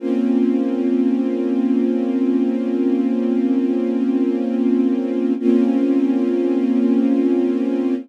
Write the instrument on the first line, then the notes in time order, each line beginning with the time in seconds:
string ensemble 1
0.00 A#3 C4 C#4 F4
5.39 A#3 C4 C#4 F4